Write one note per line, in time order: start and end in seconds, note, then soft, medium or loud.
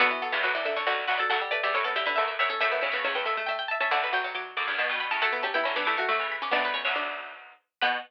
0.00 0.10 B1 medium
0.00 0.10 D2 medium
0.00 0.11 D3 medium
0.00 0.72 B3 loud
0.00 0.22 F#4 loud
0.11 0.21 E3 medium
0.22 0.32 F#3 medium
0.22 0.33 A4 medium
0.32 0.43 C#2 medium
0.32 0.43 E2 medium
0.32 0.43 E3 medium
0.32 0.43 G4 medium
0.43 0.82 D2 medium
0.43 0.82 F#2 medium
0.43 0.54 F#3 medium
0.43 0.53 B4 medium
0.55 0.65 E3 medium
0.55 0.65 D5 medium
0.65 0.75 D3 medium
0.65 0.76 E5 medium
0.76 0.86 D3 medium
0.76 1.03 C#5 medium
0.87 1.05 B1 medium
0.87 1.05 D2 medium
0.87 1.17 D3 medium
0.87 1.07 F#4 loud
1.07 1.19 B1 medium
1.07 1.19 D2 medium
1.07 1.18 F#4 loud
1.07 1.18 B4 medium
1.18 1.30 F#3 medium
1.18 1.29 A4 loud
1.18 1.28 D5 medium
1.30 1.41 D2 medium
1.30 1.41 F#2 loud
1.30 1.40 F#3 medium
1.30 1.51 A4 loud
1.30 1.50 F#5 loud
1.41 1.52 G3 medium
1.51 1.62 A3 medium
1.51 1.62 B4 loud
1.51 1.61 D5 medium
1.63 1.73 E2 medium
1.63 1.73 G2 medium
1.63 1.74 G3 medium
1.63 1.74 D5 loud
1.63 1.74 E5 medium
1.74 2.12 F#2 medium
1.74 2.12 A2 medium
1.74 1.85 A3 medium
1.74 1.85 C#5 medium
1.84 1.95 B3 medium
1.84 1.95 A4 medium
1.96 2.06 D3 medium
1.96 2.06 G4 loud
1.96 2.05 E5 medium
2.06 2.17 D3 medium
2.06 2.35 B4 medium
2.06 2.15 E5 loud
2.16 2.37 D2 medium
2.16 2.37 F#2 medium
2.16 2.44 A3 medium
2.16 2.26 E5 loud
2.28 2.38 E5 medium
2.39 2.49 D2 medium
2.39 2.49 F#2 medium
2.39 2.51 C#5 medium
2.39 2.57 E5 loud
2.50 2.60 C#4 medium
2.50 2.60 A4 medium
2.60 2.82 F#2 medium
2.60 2.82 A2 loud
2.60 2.71 A3 medium
2.60 3.43 A4 loud
2.60 2.71 E5 loud
2.72 2.82 B3 medium
2.72 2.81 E5 medium
2.81 2.93 A2 medium
2.81 2.93 C#3 medium
2.81 2.93 C#4 medium
2.81 2.91 E5 medium
2.92 3.04 A2 medium
2.92 3.04 C#3 medium
2.92 3.04 B3 medium
2.92 3.11 E5 loud
3.04 3.40 C#2 medium
3.04 3.40 E2 loud
3.04 3.15 C#4 medium
3.15 3.26 B3 medium
3.15 3.25 G5 medium
3.25 3.36 A3 medium
3.25 3.46 E5 medium
3.37 3.48 A3 medium
3.46 3.78 A3 medium
3.46 3.67 E5 loud
3.46 3.57 G5 medium
3.59 3.69 G5 medium
3.68 3.81 E5 loud
3.68 3.79 A5 medium
3.80 3.91 C#4 medium
3.80 3.92 E5 loud
3.80 3.91 A5 medium
3.91 4.52 B1 medium
3.91 4.52 D2 medium
3.91 4.10 D3 medium
3.91 4.02 D5 loud
3.91 4.11 F#5 medium
4.04 4.67 B4 loud
4.13 4.23 F#3 medium
4.13 4.34 G5 medium
4.24 4.34 F#3 medium
4.35 4.71 F#3 medium
4.35 4.54 D6 medium
4.57 4.67 D2 medium
4.57 4.67 F#2 medium
4.57 4.67 D6 medium
4.67 4.78 E2 medium
4.67 4.78 G2 medium
4.67 4.78 D6 medium
4.78 4.88 G2 medium
4.78 4.88 B2 medium
4.78 4.99 A5 medium
4.89 5.10 G2 medium
4.89 5.10 B2 medium
5.00 5.11 B5 medium
5.11 5.21 A2 medium
5.11 5.21 C#3 medium
5.11 5.21 A5 medium
5.22 5.57 F#3 medium
5.22 5.57 A3 loud
5.22 5.32 A3 medium
5.22 5.42 A4 loud
5.22 5.39 F#5 loud
5.33 5.43 B3 medium
5.43 5.54 C#4 medium
5.43 5.54 G4 loud
5.43 5.53 A5 medium
5.54 5.64 B3 medium
5.54 5.75 E4 loud
5.54 5.64 G5 medium
5.64 5.76 D3 medium
5.64 5.76 F#3 medium
5.64 5.75 C#4 medium
5.64 5.74 B5 medium
5.76 5.87 E3 medium
5.76 5.87 G3 medium
5.76 5.86 B3 medium
5.76 5.86 D4 medium
5.76 5.85 D6 medium
5.85 6.06 E3 medium
5.85 6.06 G3 medium
5.85 5.97 A3 medium
5.85 5.97 E4 medium
5.85 5.95 D6 medium
5.97 6.08 A3 medium
5.97 6.09 F#4 loud
5.97 6.23 C#6 medium
6.09 6.19 D3 medium
6.09 6.19 F#3 medium
6.09 6.49 A3 medium
6.09 6.37 A3 medium
6.19 6.50 C#3 medium
6.19 6.50 E3 medium
6.32 6.42 B5 medium
6.42 6.52 C#4 medium
6.42 6.53 D6 medium
6.51 6.82 B1 medium
6.51 6.82 D2 loud
6.51 7.21 B3 loud
6.51 6.71 D4 medium
6.51 6.63 D5 medium
6.65 6.75 B4 medium
6.74 6.94 C#4 medium
6.74 6.84 C#5 medium
6.85 7.53 B1 medium
6.85 7.53 D2 medium
6.85 7.31 C#5 medium
6.96 7.35 D4 medium
7.81 7.98 B2 loud
7.81 7.97 B3 loud
7.81 7.98 B3 loud
7.81 7.97 B4 loud